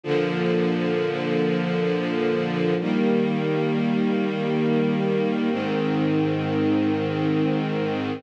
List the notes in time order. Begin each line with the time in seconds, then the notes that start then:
0.04 A#2 D3 F3
2.80 D#3 G3 A#3
5.50 G#2 D#3 C4